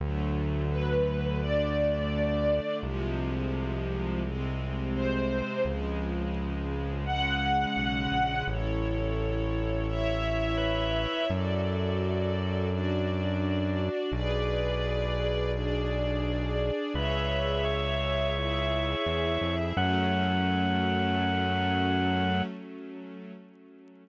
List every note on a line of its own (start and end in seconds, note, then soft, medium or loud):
0.00 2.60 D2 medium
0.00 1.40 D3 medium
0.00 1.40 F#3 medium
0.00 1.40 A3 medium
0.71 1.38 B4 medium
1.40 2.81 D3 medium
1.40 2.81 A3 medium
1.40 2.81 D4 medium
1.40 2.76 D5 medium
2.82 5.42 C2 medium
2.82 4.22 C3 medium
2.82 4.22 F3 medium
2.82 4.22 G#3 medium
4.24 5.63 C3 medium
4.24 5.63 G#3 medium
4.24 5.63 C4 medium
4.95 5.64 C5 medium
5.65 7.66 C#2 medium
5.65 7.05 C#3 medium
5.65 7.05 F3 medium
5.65 7.05 G#3 medium
7.06 8.45 C#3 medium
7.06 8.45 G#3 medium
7.06 8.45 C#4 medium
7.06 8.42 F#5 medium
7.76 8.08 B1 medium
8.11 8.43 A#1 medium
8.47 11.07 A1 medium
8.47 9.87 E4 medium
8.47 9.87 A4 medium
8.47 9.87 C#5 medium
9.88 11.28 E4 medium
9.88 11.28 C#5 medium
9.88 11.28 E5 loud
10.57 11.25 B4 medium
11.29 13.89 F#2 loud
11.29 12.69 F#4 medium
11.29 12.69 A4 medium
11.29 12.69 D5 medium
12.70 14.10 D4 medium
12.70 14.10 F#4 medium
12.70 14.10 D5 medium
14.12 16.71 B1 medium
14.12 15.52 G#4 medium
14.12 15.52 B4 medium
14.12 15.52 D5 loud
15.53 16.93 D4 medium
15.53 16.93 G#4 medium
15.53 16.93 D5 medium
16.94 18.95 C#2 medium
16.94 18.34 G#4 medium
16.94 17.64 B4 soft
16.94 18.34 C#5 medium
16.94 18.34 E5 medium
17.64 19.55 C#5 medium
18.35 19.75 E4 medium
18.35 19.75 G#4 medium
18.35 19.75 E5 medium
19.06 19.38 E2 medium
19.41 19.73 F2 medium
19.76 22.42 F#2 loud
19.76 22.42 F#3 loud
19.76 22.42 A3 loud
19.76 22.42 C#4 loud
19.76 22.43 F#5 loud